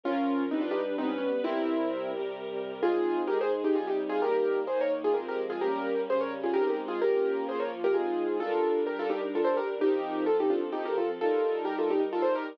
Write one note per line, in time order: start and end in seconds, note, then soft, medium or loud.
0.03 0.50 F3 medium
0.03 0.50 C#4 medium
0.03 0.43 C#4 medium
0.03 0.43 F4 medium
0.03 0.50 A#4 medium
0.50 0.96 G3 medium
0.50 0.62 C4 medium
0.50 0.96 D4 medium
0.50 0.62 D#4 medium
0.50 0.96 B4 medium
0.61 0.72 D4 medium
0.61 0.72 F4 medium
0.71 0.82 D#4 medium
0.71 0.82 G4 medium
0.97 1.43 G3 medium
0.97 1.43 B3 medium
0.97 1.09 C4 medium
0.97 1.09 D#4 medium
0.97 1.43 B4 medium
1.09 1.18 C#4 medium
1.18 1.29 C#4 medium
1.43 2.12 C3 medium
1.43 2.12 G3 medium
1.43 2.10 C4 medium
1.43 2.12 E4 medium
1.43 2.10 E4 medium
1.43 2.12 A#4 medium
2.13 2.82 C3 medium
2.13 2.82 G3 medium
2.13 2.82 G4 medium
2.13 2.82 A#4 medium
2.83 3.29 G#3 medium
2.83 3.29 C4 medium
2.83 3.29 D#4 medium
2.83 3.21 F4 medium
2.83 3.21 G#4 medium
3.27 3.75 G#3 medium
3.27 3.75 D#4 medium
3.27 3.38 G4 medium
3.27 3.75 G#4 medium
3.27 3.38 A#4 medium
3.41 3.52 G#4 medium
3.41 3.52 C5 medium
3.64 3.75 D#4 medium
3.64 3.75 G4 medium
3.75 4.22 C3 medium
3.75 4.21 G3 medium
3.75 4.22 D#4 medium
3.75 3.86 F4 medium
3.75 3.86 G#4 medium
3.87 3.98 D#4 medium
3.87 3.98 G4 medium
4.09 4.20 F4 medium
4.09 4.20 G#4 medium
4.22 4.68 D#3 medium
4.22 4.68 G3 medium
4.22 4.68 A#3 medium
4.22 4.59 G4 medium
4.22 4.59 A#4 medium
4.67 5.14 D#3 medium
4.67 5.14 A#3 medium
4.67 5.14 D#4 medium
4.67 4.78 G#4 medium
4.67 4.78 C5 medium
4.81 4.92 A#4 medium
4.81 4.92 C#5 medium
5.04 5.15 F4 medium
5.04 5.15 G#4 medium
5.14 5.61 F3 medium
5.14 5.61 G#3 medium
5.14 5.61 C4 medium
5.14 5.25 G4 soft
5.14 5.25 A#4 medium
5.28 5.39 G4 medium
5.28 5.39 A#4 medium
5.50 5.61 F4 medium
5.50 5.61 G#4 medium
5.61 6.07 G3 medium
5.61 6.07 A#3 medium
5.61 6.07 C#4 medium
5.61 6.01 G4 medium
5.61 6.01 A#4 medium
6.08 6.54 C#3 medium
6.08 6.54 G3 medium
6.08 6.54 C#4 medium
6.08 6.21 G#4 medium
6.08 6.21 C5 medium
6.21 6.32 A#4 medium
6.21 6.32 C#5 medium
6.43 6.54 F4 medium
6.43 6.54 G#4 medium
6.54 7.01 G#3 medium
6.54 7.01 C4 medium
6.54 7.01 D#4 medium
6.54 6.65 G4 medium
6.54 6.65 A#4 medium
6.67 6.78 G4 medium
6.67 6.78 A#4 medium
6.88 6.99 F4 medium
6.88 6.99 G#4 medium
7.01 7.47 A#3 medium
7.01 7.48 C#4 medium
7.01 7.47 F4 medium
7.01 7.44 G4 medium
7.01 7.44 A#4 medium
7.48 7.94 F3 medium
7.48 7.94 A#3 medium
7.48 7.94 F4 medium
7.48 7.60 G#4 medium
7.48 7.60 C5 medium
7.60 7.71 A#4 soft
7.60 7.71 C#5 medium
7.84 7.95 G4 medium
7.84 7.95 A#4 medium
7.94 8.40 G#3 medium
7.94 8.40 C4 medium
7.94 8.40 D#4 medium
7.94 8.37 F4 medium
7.94 8.37 G#4 medium
8.40 9.79 G3 medium
8.40 9.79 D4 medium
8.40 8.81 F4 medium
8.40 8.81 A4 medium
8.40 9.79 A#4 medium
8.87 8.98 G4 medium
8.87 8.98 A#4 medium
8.99 9.10 F4 medium
8.99 9.10 A4 medium
9.10 9.21 D#4 medium
9.10 9.21 G4 medium
9.35 9.46 F4 medium
9.35 9.44 A4 medium
9.44 9.55 A4 medium
9.44 9.55 C5 medium
9.57 9.68 G4 medium
9.57 9.68 A#4 medium
9.80 10.26 F3 medium
9.80 10.26 C4 medium
9.80 10.24 D#4 medium
9.80 10.24 G4 medium
9.80 10.27 A#4 medium
10.26 11.19 F3 medium
10.26 11.19 C4 medium
10.26 10.37 F4 medium
10.26 10.37 A4 medium
10.26 11.19 A4 medium
10.40 10.51 D#4 medium
10.40 10.51 G4 medium
10.50 10.61 D4 medium
10.50 10.61 F4 medium
10.72 10.83 D#4 medium
10.72 10.83 G4 medium
10.85 10.96 G4 medium
10.85 10.96 A#4 medium
10.98 11.09 F4 medium
10.98 11.09 A4 medium
11.20 12.58 G3 medium
11.20 12.58 D#4 medium
11.20 11.63 F4 medium
11.20 11.63 A4 medium
11.20 12.58 A#4 medium
11.65 11.76 G4 medium
11.65 11.76 A#4 medium
11.79 11.90 F4 medium
11.79 11.90 A4 medium
11.90 12.01 D#4 medium
11.90 12.01 G4 medium
12.13 12.24 F4 medium
12.13 12.22 A4 medium
12.22 12.33 A4 medium
12.22 12.33 C5 medium
12.35 12.46 G4 medium
12.35 12.46 A#4 medium